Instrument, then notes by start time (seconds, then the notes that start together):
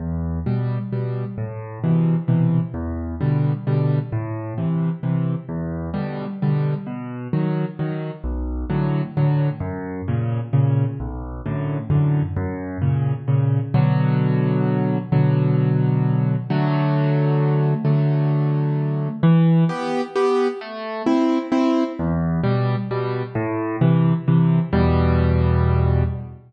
acoustic grand piano
0.00 E2
0.46 B2 G3
0.92 B2 G3
1.38 A2
1.84 B2 C3 E3
2.28 B2 C3 E3
2.74 E2
3.21 B2 D3 G3
3.67 B2 D3 G3
4.12 A2
4.58 C3 E3
5.03 C3 E3
5.49 E2
5.94 B2 D3 G3
6.42 B2 D3 G3
6.87 B2
7.33 D#3 F#3
7.79 D#3 F#3
8.24 B1
8.70 A2 D3 F#3
9.17 A2 D3 F#3
9.60 F#2
10.08 A#2 C#3
10.53 A#2 C#3
11.00 B1
11.46 F#2 A2 D3
11.90 F#2 A2 D3
12.37 F#2
12.81 A#2 C#3
13.28 A#2 C#3
13.74 B2 D3 F#3
15.12 B2 D3 F#3
16.50 D3 F#3 A3
17.85 D3 F#3 A3
19.23 E3
19.69 B3 G4
20.15 B3 G4
20.61 A3
21.06 C4 E4
21.52 C4 E4
21.99 E2
22.44 B2 G3
22.91 B2 G3
23.35 A2
23.81 C3 E3
24.28 C3 E3
24.73 E2 B2 G3